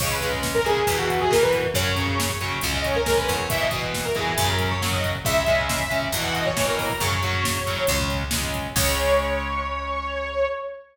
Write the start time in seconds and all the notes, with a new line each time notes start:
0.00 C#2 C#3 G#3 C#5, kick, crash
0.11 B4, kick
0.21 C#3 G#3, kick, closed hi-hat
0.33 kick
0.43 kick, snare
0.54 A#4, kick
0.65 C#3 G#3 G#4, kick, closed hi-hat
0.77 kick
0.87 E2 B2 E3, kick, closed hi-hat
0.98 F#4, kick
1.10 kick, closed hi-hat
1.20 G#4, kick
1.31 B2 E3 A#4, kick, snare
1.42 B4, kick
1.53 kick, closed hi-hat
1.64 kick
1.74 F#2 C#3 F#3 C#5, kick, closed hi-hat
1.85 kick
1.96 C#3 F#3, kick, closed hi-hat
2.08 kick
2.19 C#5, kick, snare
2.30 kick
2.41 C#3 F#3, kick, closed hi-hat
2.52 kick
2.61 C#2 C#3 G#3, kick, closed hi-hat
2.74 D#5, kick
2.84 C#5, kick, closed hi-hat
2.94 A#4, kick
3.06 C#3 G#3, kick, snare
3.18 B4, kick
3.28 E2 C#5, kick, closed hi-hat
3.38 kick
3.50 B2 E3 E5, kick, closed hi-hat
3.61 D#5, kick
3.71 B2 E3, kick, closed hi-hat
3.83 kick
3.94 kick, snare
4.05 A#4, kick
4.15 B2 E3 G#4, kick, closed hi-hat
4.27 kick
4.38 F#2 C#3 F#3, kick, closed hi-hat
4.48 A#4, kick
4.59 kick, closed hi-hat
4.71 C#5, kick
4.81 C#3 F#3 C#5, kick, snare
4.92 D#5, kick
5.04 kick, closed hi-hat
5.15 kick
5.25 C#2 C#3 G#3 E5, kick, closed hi-hat
5.35 kick
5.46 C#3 G#3, kick, closed hi-hat
5.59 kick
5.69 E5, kick, snare
5.79 kick
5.90 C#3 G#3, kick, closed hi-hat
6.02 kick
6.12 E2 B2 E3, kick, closed hi-hat
6.23 F#5, kick
6.35 D#5, kick, closed hi-hat
6.46 C#5, kick
6.57 B2 E3, kick, snare
6.67 A#4, kick
6.79 A#4, kick, open hi-hat
6.89 kick
7.00 F#2 C#3 F#3 C#5, kick, closed hi-hat
7.12 kick
7.23 C#3 F#3, kick, closed hi-hat
7.33 kick
7.44 kick, snare
7.57 kick
7.67 C#3 F#3, kick, closed hi-hat
7.77 kick
7.87 C#2 C#3 G#3, kick, closed hi-hat
7.99 kick
8.10 kick, closed hi-hat
8.22 kick
8.31 C#3 G#3, kick, snare
8.42 kick
8.54 kick, closed hi-hat
8.64 kick
8.76 C#2 C#3 G#3 C#5, kick, crash